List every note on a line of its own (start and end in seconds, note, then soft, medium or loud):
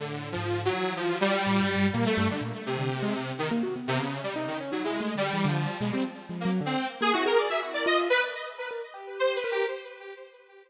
0.00 0.33 A2 medium
0.00 0.29 D3 medium
0.32 0.69 G#2 medium
0.32 0.61 F3 medium
0.65 0.94 F#3 medium
0.72 1.15 E3 medium
0.96 1.18 F3 medium
1.21 1.86 G3 loud
1.47 1.61 A2 medium
1.61 1.75 G2 medium
1.76 1.90 G2 medium
1.93 2.05 A#2 medium
1.93 2.04 A#3 medium
2.06 2.27 A3 medium
2.17 2.28 G2 loud
2.30 2.41 D3 medium
2.41 2.52 A#2 medium
2.66 3.32 C3 medium
2.78 2.89 D3 medium
3.03 3.13 G#3 loud
3.38 3.49 D#3 medium
3.51 3.62 A#3 loud
3.63 3.74 F#4 medium
3.76 4.09 B3 medium
3.88 3.98 C3 loud
3.99 4.20 C#3 medium
4.23 4.34 G3 medium
4.36 4.58 D#4 loud
4.47 4.58 D#3 medium
4.60 4.71 C#4 loud
4.72 4.83 F#3 medium
4.72 4.83 D#4 medium
4.84 5.13 G#3 medium
4.84 4.99 E4 medium
5.00 5.15 A3 medium
5.15 5.30 D3 medium
5.15 5.46 G3 medium
5.33 5.44 E3 medium
5.45 5.67 D3 loud
5.45 5.77 F3 medium
5.80 5.91 B2 medium
5.80 5.91 G#3 medium
5.93 6.04 G3 loud
5.93 6.03 C4 medium
6.29 6.44 F3 medium
6.40 6.51 A#3 medium
6.45 6.60 F#3 loud
6.61 6.75 D3 loud
6.66 6.87 C4 medium
7.01 7.12 A#3 loud
7.01 7.13 G#4 loud
7.13 7.26 E4 medium
7.13 7.24 F#4 medium
7.26 7.48 G#4 loud
7.26 7.37 A#4 medium
7.38 7.49 D5 medium
7.49 7.61 F#4 soft
7.49 7.60 E5 medium
7.62 7.84 E4 medium
7.74 7.85 D5 medium
7.86 8.08 F4 medium
7.86 7.97 D#5 loud
8.10 8.21 B4 loud
8.58 8.69 A#4 medium
8.71 8.82 A#4 medium
8.94 9.38 G4 medium
9.19 9.34 C5 medium
9.35 9.50 B4 soft
9.44 9.66 A#4 medium
9.51 9.66 G4 medium